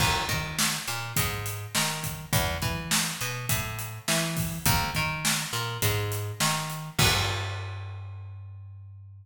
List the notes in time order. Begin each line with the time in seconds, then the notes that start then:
0.00 D#2, kick, crash
0.29 D#3, kick, closed hi-hat
0.59 snare
0.87 A#2, closed hi-hat
1.16 G#2, kick, closed hi-hat
1.46 closed hi-hat
1.75 D#3, snare
2.04 kick, closed hi-hat
2.33 E2, kick, closed hi-hat
2.62 E3, kick, closed hi-hat
2.91 snare
3.21 B2, closed hi-hat
3.49 A2, kick, closed hi-hat
3.79 closed hi-hat
4.08 E3, snare
4.37 kick, open hi-hat
4.66 D#2, kick, closed hi-hat
4.95 D#3, kick, closed hi-hat
5.25 snare
5.53 A#2, closed hi-hat
5.82 G#2, kick, closed hi-hat
6.12 closed hi-hat
6.40 D#3, snare
6.70 closed hi-hat
6.99 G2, kick, crash